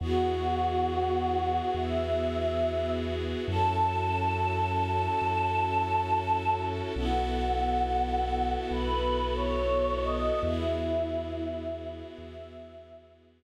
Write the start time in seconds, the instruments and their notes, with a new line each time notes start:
0.00 synth bass 2 E2, string ensemble 1 B3 E4 F#4 G#4, choir aahs F#4
1.74 synth bass 2 E2, choir aahs E5
3.47 synth bass 2 F#2, string ensemble 1 C#4 E4 F#4 A4, choir aahs A5
5.22 synth bass 2 F#2
6.96 synth bass 2 B1, string ensemble 1 B3 E4 F#4 A4, choir aahs F#5
8.69 synth bass 2 B1, choir aahs B4
9.35 choir aahs C#5
10.00 choir aahs D#5
10.43 synth bass 2 E2, string ensemble 1 B3 E4 F#4 G#4, choir aahs E4
12.17 synth bass 2 E2, choir aahs E5